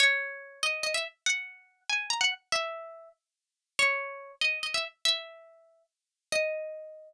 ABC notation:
X:1
M:6/8
L:1/16
Q:3/8=95
K:D#phr
V:1 name="Pizzicato Strings"
c6 d2 d e z2 | f6 g2 a f z2 | e6 z6 | c6 d2 d e z2 |
e8 z4 | d12 |]